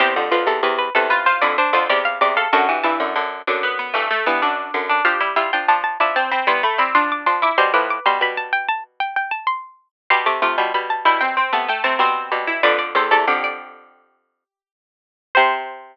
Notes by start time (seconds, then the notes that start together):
0.00 E2 C3 G4 C5
0.16 F2 D3
0.31 F2 D3 F4 B4
0.47 E2 C3 A4
0.63 E2 C3 B4
0.78 B4
0.95 E2 C3 A4 B4
1.10 F4 B4
1.26 F4 C5
1.41 F2 D3 E4 D5
1.58 D4 C5
1.73 F2 D3 F4 C5
1.89 E2 C3 G4 D5
2.05 F5
2.21 E2 C3 D5
2.36 A4 F5
2.53 F#2 D3 F#4 A5
2.69 G2 E3
2.83 G2 E3 E4 A5
3.00 F#2 D3
3.16 F#2 D3
3.47 F#2 D3 D4
3.63 B3
3.79 B3
3.94 G2 E3 A3
4.11 A3
4.26 G2 E3 B3
4.42 F#2 D3 D4
4.74 F#2 D3
4.89 D4
5.05 F3 D4 G4 F5
5.21 G3 E4
5.36 G3 E4 F4 E5
5.53 F3 D4 G5
5.68 F3 D4 A5
5.84 A5
6.00 F3 D4 E4 A5
6.16 C4 A5
6.31 C4 B5
6.47 G3 B3 E4 C6
6.63 A3 B5
6.78 G3 C4 E4 B5
6.95 F3 D4 C6
7.12 D6
7.26 F3 D4 C6
7.42 E4 D6
7.58 B2 G3 C5 C6
7.73 A2 F3 B4 D6
7.90 D6
8.06 B2 G3 C6
8.21 B2 G3 B5
8.37 A5
8.52 G5
8.68 A5
9.00 G5
9.16 G5
9.31 A5
9.47 C6
10.10 B2 G3 G4 C6
10.26 C3 A3 D6
10.42 C3 A3 F4 D6
10.58 B2 G3 C6
10.74 B2 G3 B5
10.90 A5
11.05 B2 G3 E4 G5
11.21 C4 G5
11.37 C4
11.53 C3 A3 B3 A5
11.68 A3 G5
11.83 C3 A3 C4 A5
11.99 B2 G3 C4 C6
12.32 B2 G3
12.47 E4
12.63 F2 D3 B4 D5
12.79 D5
12.95 E2 C3 A4 C5
13.11 E2 C3 A4 D5
13.27 F2 D3 G4
13.44 D5
15.35 C3 C5